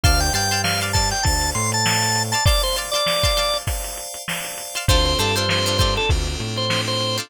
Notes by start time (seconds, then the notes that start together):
0.04 D2 C5 D5 F5 A5 C6, kick, closed hi-hat
0.20 G5, closed hi-hat
0.33 G2 D5 F5 G5 A5 C6, closed hi-hat
0.51 D5 F5 A5 C6, closed hi-hat
0.64 C5 D5 F5 A5, snare
0.81 D5 F5 A5 C6, closed hi-hat
0.93 D5 F5 A5 C6, kick, snare, closed hi-hat
1.11 G5, closed hi-hat
1.23 D2 C5 D5 F5 A5, kick, closed hi-hat
1.41 closed hi-hat
1.55 A2 C6, closed hi-hat
1.72 A5, closed hi-hat
1.85 C5 D5 F5 A5, snare
2.02 closed hi-hat
2.16 closed hi-hat
2.32 D5 F5 A5 C6, closed hi-hat
2.45 C5 D5 F5 A5 C6, kick, closed hi-hat
2.63 C5, closed hi-hat
2.76 D5 F5 A5 C6, closed hi-hat
2.92 D5 F5 A5 C6, snare, closed hi-hat
2.96 D5
3.06 C5 D5 F5 A5, snare
3.23 D5 F5 A5 C6, kick, closed hi-hat
3.37 D5 F5 A5 C6, snare, closed hi-hat
3.54 closed hi-hat
3.67 C5 D5 F5 A5, kick, closed hi-hat
3.84 closed hi-hat
3.97 closed hi-hat
4.14 closed hi-hat
4.28 C5 D5 F5 A5, snare
4.45 closed hi-hat
4.58 closed hi-hat
4.75 D5 F5 A5 C6, closed hi-hat
4.88 D2 C4 D4 F4 A4 C5, kick, closed hi-hat
5.05 C5, closed hi-hat
5.18 G2 D4 F4 A4 C5, snare, closed hi-hat
5.36 D4 F4 A4 C5, closed hi-hat
5.49 C4 D4 F4 A4 C5, snare
5.65 D4 F4 A4 C5, snare, closed hi-hat
5.78 D4 F4 A4 C5, kick, snare, closed hi-hat
5.96 A4, closed hi-hat
6.09 D2 C4 D4 F4 A4, kick, closed hi-hat
6.27 snare, closed hi-hat
6.40 A2, closed hi-hat
6.56 C5, closed hi-hat
6.70 C4 D4 F4 A4, snare
6.87 C5, snare, closed hi-hat
7.01 closed hi-hat
7.17 D4 F4 A4 C5, closed hi-hat